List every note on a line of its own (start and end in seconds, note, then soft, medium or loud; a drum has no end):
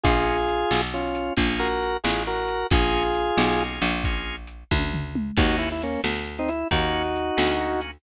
0.04 0.65 A#1 loud
0.04 0.37 A#3 medium
0.04 0.37 C#4 medium
0.04 0.81 F4 loud
0.04 0.37 F4 medium
0.04 0.81 G#4 loud
0.04 0.37 G#4 medium
0.04 kick loud
0.04 closed hi-hat loud
0.49 closed hi-hat medium
0.71 1.31 B1 medium
0.71 snare loud
0.94 1.33 C#4 medium
0.94 1.33 F4 loud
1.15 closed hi-hat medium
1.37 1.97 A#1 loud
1.37 1.68 A#3 loud
1.37 1.68 C#4 medium
1.37 1.68 F4 medium
1.37 1.68 G#4 medium
1.37 kick medium
1.37 closed hi-hat loud
1.59 1.97 F#4 loud
1.59 1.97 A#4 loud
1.83 closed hi-hat medium
2.04 2.64 A1 medium
2.04 2.23 F4 medium
2.04 2.23 G#4 loud
2.04 snare loud
2.27 2.67 F#4 loud
2.27 2.67 A#4 loud
2.48 closed hi-hat medium
2.70 3.31 A#1 loud
2.70 3.03 A#3 medium
2.70 3.03 C#4 medium
2.70 3.03 F4 medium
2.70 3.63 F4 loud
2.70 3.03 G#4 loud
2.70 3.63 G#4 loud
2.70 kick loud
2.70 closed hi-hat loud
3.14 closed hi-hat medium
3.37 3.80 B1 loud
3.37 snare loud
3.60 3.91 A#3 medium
3.60 3.91 C#4 medium
3.60 3.91 F4 medium
3.60 3.91 G#4 medium
3.82 4.64 A#1 loud
3.82 closed hi-hat medium
4.04 4.36 A#3 medium
4.04 4.36 C#4 medium
4.04 4.36 F4 medium
4.04 4.36 G#4 medium
4.04 kick loud
4.04 closed hi-hat loud
4.47 closed hi-hat medium
4.71 5.31 D2 loud
4.71 kick loud
4.71 high tom medium
4.94 floor tom loud
5.15 mid tom loud
5.37 5.97 D#2 loud
5.37 5.69 A#3 medium
5.37 5.69 C#4 medium
5.37 5.69 D#4 medium
5.37 5.56 D#4 loud
5.37 5.69 F#4 medium
5.37 5.56 F#4 loud
5.37 kick loud
5.37 crash loud
5.59 5.69 E4 loud
5.72 5.82 E4 loud
5.82 6.01 A#3 medium
5.82 6.01 C#4 loud
5.82 closed hi-hat medium
6.04 6.64 D2 medium
6.04 snare loud
6.39 6.49 C4 loud
6.39 6.49 D#4 loud
6.48 6.68 E4 loud
6.48 closed hi-hat medium
6.71 7.31 D#2 loud
6.71 7.02 A#3 loud
6.71 7.02 C#4 medium
6.71 7.02 D#4 medium
6.71 7.80 D#4 loud
6.71 7.02 F#4 loud
6.71 7.80 F#4 loud
6.71 kick medium
6.71 closed hi-hat loud
7.16 closed hi-hat medium
7.37 7.98 D2 medium
7.37 7.52 A#3 medium
7.37 7.52 C#4 medium
7.37 7.52 D#4 medium
7.37 7.52 F#4 medium
7.37 snare loud
7.60 7.91 A#3 medium
7.60 7.91 C#4 medium
7.60 7.91 D#4 medium
7.60 7.91 F#4 medium
7.81 closed hi-hat medium